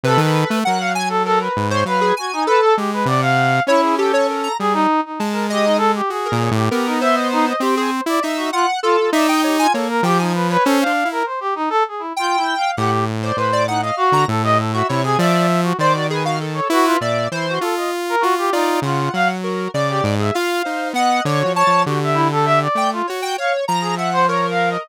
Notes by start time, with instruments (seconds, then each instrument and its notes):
0.03 lead 2 (sawtooth) C3, brass section A4, lead 1 (square) B4
0.17 lead 2 (sawtooth) D#3, brass section A4
0.48 lead 2 (sawtooth) A3, brass section A4
0.64 lead 2 (sawtooth) F#3, brass section A#4, lead 1 (square) F#5
0.80 brass section F5
0.95 lead 1 (square) G#5
1.09 brass section A4
1.25 brass section A4, lead 1 (square) A#4
1.41 brass section B4
1.57 lead 2 (sawtooth) G#2
1.70 lead 1 (square) C5, brass section C#5
1.85 lead 2 (sawtooth) F#3, brass section B4, lead 1 (square) F5
2.01 lead 1 (square) G#4
2.17 brass section F#4, lead 1 (square) G#5
2.33 brass section D#4
2.47 lead 1 (square) A4, brass section B4
2.62 brass section A4
2.77 lead 2 (sawtooth) G#3, brass section G4
2.93 brass section B4
3.05 lead 2 (sawtooth) C3, brass section D5, lead 1 (square) F#5
3.22 brass section F5
3.67 lead 2 (sawtooth) C#4, brass section E4, lead 1 (square) C#5
3.83 lead 1 (square) G#4
3.98 lead 1 (square) G4, brass section A4
4.13 lead 1 (square) C#5
4.28 lead 1 (square) A#4
4.43 lead 1 (square) A#5
4.59 lead 2 (sawtooth) G3, brass section G#4
4.73 brass section D#4
5.05 brass section D#4
5.19 lead 2 (sawtooth) G#3, lead 1 (square) A5
5.32 brass section A#4
5.50 brass section G4, lead 1 (square) D#5
5.65 brass section D#4
5.78 brass section A4
5.95 brass section G4
6.10 lead 2 (sawtooth) F#4, brass section G#4
6.25 lead 1 (square) A#4
6.32 lead 2 (sawtooth) A#2
6.41 lead 1 (square) C#5
6.51 lead 2 (sawtooth) A2, brass section G4
6.71 lead 2 (sawtooth) B3, brass section G4, lead 1 (square) A#4
6.86 brass section D#4
7.01 lead 1 (square) C5, brass section E5
7.14 brass section D#5
7.32 brass section D#4
7.47 brass section D#5
7.60 lead 2 (sawtooth) C4, lead 1 (square) G4, brass section C5
7.75 lead 1 (square) G#4, brass section C5
8.06 lead 2 (sawtooth) E4, brass section D5
8.22 lead 2 (sawtooth) D#4, lead 1 (square) E5
8.36 brass section F#4
8.52 brass section F4, lead 1 (square) F#5
8.83 brass section F4, lead 1 (square) A4
8.97 brass section F4
9.13 lead 2 (sawtooth) D#4, brass section D5, lead 1 (square) E5
9.27 brass section D#5, lead 1 (square) G5
9.44 brass section G4, lead 1 (square) C#5
9.59 brass section F4, lead 1 (square) G#5
9.74 lead 2 (sawtooth) A#3, brass section A4, lead 1 (square) C#5
9.90 brass section A#4
10.03 lead 2 (sawtooth) F3, brass section G4, lead 1 (square) G5
10.19 brass section D#4, lead 1 (square) G#5
10.34 brass section B4
10.50 brass section B4, lead 1 (square) C#5
10.64 lead 2 (sawtooth) C#4, brass section A4, lead 1 (square) C5
10.81 brass section F5
10.86 lead 2 (sawtooth) D4
11.05 lead 2 (sawtooth) E4
11.12 brass section A#4
11.26 brass section C5
11.40 brass section G4
11.55 brass section D#4
11.70 brass section A4
11.88 brass section G#4
11.99 brass section E4
12.16 brass section F4, lead 1 (square) G5
12.37 brass section E4
12.57 brass section F5
12.77 lead 2 (sawtooth) A2, brass section G4, lead 1 (square) F#5
13.23 lead 1 (square) C5, brass section D5
13.36 lead 2 (sawtooth) A2, lead 1 (square) B4, brass section C5
13.53 lead 1 (square) D5
13.67 brass section D#4, lead 1 (square) F#5
13.81 brass section D#5, lead 1 (square) F5
13.97 brass section F#4
14.12 lead 2 (sawtooth) D3, lead 1 (square) A#5
14.28 lead 2 (sawtooth) A2, brass section A4
14.44 lead 1 (square) G4, brass section D#5
14.58 brass section A4
14.73 brass section F#4, lead 1 (square) E5
14.88 lead 2 (sawtooth) C3, brass section E4, lead 1 (square) C#5
15.04 brass section G#4, lead 1 (square) G#5
15.18 lead 2 (sawtooth) F3, lead 1 (square) D5, brass section E5
15.63 brass section F#4
15.79 lead 2 (sawtooth) D#3, brass section C5, lead 1 (square) D5
15.93 brass section F#4
16.10 lead 1 (square) G#4, brass section B4
16.24 brass section F#4, lead 1 (square) F5
16.41 lead 1 (square) A4
16.54 brass section C#5
16.70 lead 2 (sawtooth) E4, brass section F#4, lead 1 (square) B4
16.85 brass section F4
16.99 lead 2 (sawtooth) A#2, lead 1 (square) D5, brass section E5
17.31 lead 2 (sawtooth) E3, brass section E4, lead 1 (square) C5
17.49 brass section F#4
17.61 lead 2 (sawtooth) F4, brass section A4
17.77 brass section D#5
18.09 brass section A#4
18.21 lead 2 (sawtooth) F4, brass section F#4
18.38 brass section G4
18.53 brass section D#4, lead 2 (sawtooth) F4, lead 1 (square) D5
18.82 lead 2 (sawtooth) C#3, brass section F4, lead 1 (square) F#5
19.14 lead 2 (sawtooth) F#3, brass section F5
19.41 brass section F#4, lead 1 (square) A#4
19.74 lead 2 (sawtooth) C#3, lead 1 (square) D5, brass section D5
19.89 brass section G4
20.04 lead 2 (sawtooth) G#2
20.19 lead 1 (square) G#4, brass section E5
20.34 lead 2 (sawtooth) F4, brass section F5, lead 1 (square) F5
20.65 lead 2 (sawtooth) D#4, lead 1 (square) C5
20.93 lead 2 (sawtooth) B3, brass section D#5, lead 1 (square) F#5
21.25 lead 2 (sawtooth) D3, lead 1 (square) C#5, brass section D5
21.39 brass section F#4
21.45 lead 2 (sawtooth) F3
21.55 brass section C#5, lead 1 (square) A5
21.67 lead 2 (sawtooth) F3
21.85 lead 2 (sawtooth) D3, brass section F#4, lead 1 (square) G4
22.03 brass section E5
22.14 brass section E4
22.32 brass section A4
22.45 brass section E5
22.62 brass section D5
22.75 lead 2 (sawtooth) A3, lead 1 (square) G5
22.93 brass section F4
23.07 lead 2 (sawtooth) F#4, lead 1 (square) C#5
23.22 lead 1 (square) G5
23.38 lead 1 (square) C#5, brass section F5
23.68 lead 2 (sawtooth) F3, lead 1 (square) A#5
23.81 brass section G#4
23.96 brass section E5, lead 1 (square) F#5
24.13 brass section C5
24.28 lead 1 (square) A#4, brass section C#5
24.51 brass section F5
24.70 brass section D#5